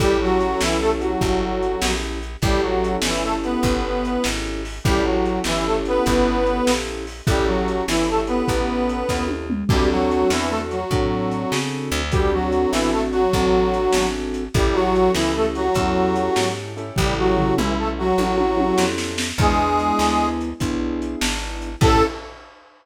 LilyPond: <<
  \new Staff \with { instrumentName = "Harmonica" } { \time 12/8 \key a \major \tempo 4. = 99 <g g'>8 <fis fis'>4 <e e'>8 <a a'>16 r16 <fis fis'>2~ <fis fis'>8 r4 | <g g'>8 <fis fis'>4 <e e'>8 <a a'>16 r16 <b b'>2~ <b b'>8 r4 | <g g'>8 <fis fis'>4 <e e'>8 <a a'>16 r16 <b b'>2~ <b b'>8 r4 | <g g'>8 <fis fis'>4 <e e'>8 <a a'>16 r16 <b b'>2~ <b b'>8 r4 |
<g g'>8 <fis fis'>4 <e e'>8 <a a'>16 r16 <fis fis'>2~ <fis fis'>8 r4 | <g g'>8 <fis fis'>4 <e e'>8 <a a'>16 r16 <fis fis'>2~ <fis fis'>8 r4 | <g g'>8 <fis fis'>4 <e e'>8 <a a'>16 r16 <fis fis'>2~ <fis fis'>8 r4 | <g g'>8 <fis fis'>4 <e e'>8 <a a'>16 r16 <fis fis'>2~ <fis fis'>8 r4 |
<gis gis'>2~ <gis gis'>8 r2. r8 | a'4. r1 r8 | }
  \new Staff \with { instrumentName = "Acoustic Grand Piano" } { \time 12/8 \key a \major <cis' e' g' a'>1. | <cis' e' g' a'>1. | <cis' e' g' a'>1. | <cis' e' g' a'>1. |
<c' d' fis' a'>2. <c' d' fis' a'>2. | <c' d' fis' a'>2. <c' d' fis' a'>2. | <cis' e' g' a'>2. <cis' e' g' a'>2~ <cis' e' g' a'>8 <cis' e' g' a'>8~ | <cis' e' g' a'>2. <cis' e' g' a'>2. |
<b d' e' gis'>2. <b d' e' gis'>2. | <cis' e' g' a'>4. r1 r8 | }
  \new Staff \with { instrumentName = "Electric Bass (finger)" } { \clef bass \time 12/8 \key a \major a,,4. b,,4. g,,4. ais,,4. | a,,4. g,,4. g,,4. gis,,4. | a,,4. g,,4. g,,4. ais,,4. | a,,4. g,,4. a,,4. dis,4. |
d,4. e,4. a,4. cis4 d,8~ | d,4. a,,4. a,,4. gis,,4. | a,,4. cis,4. e,4. gis,4. | a,,4. b,,4. a,,4. f,4. |
e,4. d,4. b,,4. gis,,4. | a,4. r1 r8 | }
  \new DrumStaff \with { instrumentName = "Drums" } \drummode { \time 12/8 <hh bd>4 hh8 sn4 hh8 <hh bd>4 hh8 sn4 hh8 | <hh bd>4 hh8 sn4 hh8 <hh bd>4 hh8 sn4 hho8 | <hh bd>4 hh8 sn4 hh8 <hh bd>4 hh8 sn4 hho8 | <hh bd>4 hh8 sn4 hh8 <hh bd>4 hh8 <bd sn>8 tommh8 toml8 |
<cymc bd>4 hh8 sn4 hh8 <hh bd>4 hh8 sn4 hho8 | <hh bd>4 hh8 sn4 hh8 <hh bd>4 hh8 sn4 hh8 | <hh bd>4 hh8 sn4 hh8 <hh bd>4 hh8 sn4 hh8 | <bd tomfh>4 tomfh8 toml4. tommh8 tommh8 tommh8 sn8 sn8 sn8 |
<cymc bd>4 hh8 sn4 hh8 <hh bd>4 hh8 sn4 hh8 | <cymc bd>4. r4. r4. r4. | }
>>